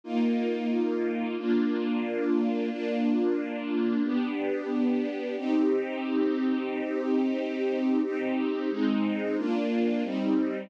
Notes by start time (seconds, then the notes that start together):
0.04 A#3 D#4 F4
1.37 A#3 D4 F4
2.70 A#3 D4 F4
4.03 B3 D4 G4
5.37 C4 D#4 G4
8.03 C4 D#4 G4
8.70 G#3 C4 D#4
9.37 A#3 D4 F4
10.03 G3 C4 D#4